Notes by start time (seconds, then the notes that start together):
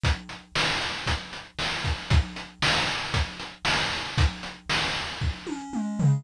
0.04 kick, closed hi-hat
0.29 closed hi-hat
0.55 snare
0.81 closed hi-hat
1.06 kick, closed hi-hat
1.33 closed hi-hat
1.59 snare
1.84 kick, closed hi-hat
2.10 kick, closed hi-hat
2.36 closed hi-hat
2.62 snare
2.87 closed hi-hat
3.14 kick, closed hi-hat
3.40 closed hi-hat
3.65 snare
3.92 closed hi-hat
4.18 kick, closed hi-hat
4.43 closed hi-hat
4.70 snare
4.95 closed hi-hat
5.21 kick
5.47 high tom
5.73 mid tom
5.99 floor tom